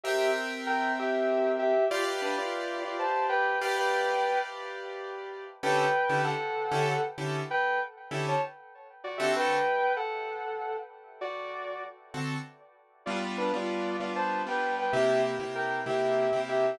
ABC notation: X:1
M:12/8
L:1/8
Q:3/8=129
K:G
V:1 name="Distortion Guitar"
[Ge]2 z2 [_Bg]2 [Ge]4 [Ge]2 | [=Fd] z [DB] [Fd]3 [Fd] [ca]2 [Bg]2 [Bg] | [Bg]5 z7 | [K:D] [Bg]4 [Af]6 z2 |
[Bg]2 z3 [ca] z4 [Fd] [Ge] | [Bg]4 [Af]6 z2 | [Fd]5 z7 | [K:G] [=Fd] z [DB] [Fd]3 [Fd] [ca]2 [Bg]2 [Bg] |
[Ge]2 z2 [_Bg]2 [Ge]4 [Ge]2 |]
V:2 name="Acoustic Grand Piano"
[C_Beg]12 | [GBd=f]11 [GBdf]- | [GBd=f]12 | [K:D] [D,CEGA]3 [D,CEGA]4 [D,CEGA]3 [D,CEGA]2- |
[D,CEGA]4 [D,CEGA]7 [D,=CFA]- | [D,=CFA]12- | [D,=CFA]6 [D,CFA]6 | [K:G] [G,B,D=F]3 [G,B,DF]3 [G,B,DF]3 [G,B,DF]3 |
[C,_B,EG]3 [C,B,EG]3 [C,B,EG]3 [C,B,EG]3 |]